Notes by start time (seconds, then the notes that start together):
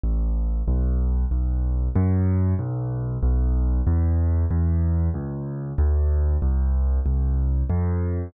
0.03 A1
0.68 B1
1.31 B1
1.95 F#2
2.59 B1
3.23 B1
3.87 E2
4.51 E2
5.14 C#2
5.78 D2
6.42 C2
7.06 C2
7.70 F2